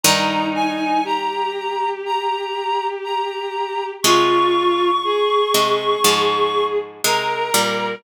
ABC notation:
X:1
M:4/4
L:1/8
Q:1/4=60
K:Ab
V:1 name="Clarinet"
b a b2 b2 b2 | d'6 b2 |]
V:2 name="Violin"
E2 G6 | F2 A4 B2 |]
V:3 name="Pizzicato Strings" clef=bass
[G,,E,]6 z2 | [C,A,]3 [C,A,] [A,,F,]2 [C,A,] [B,,G,] |]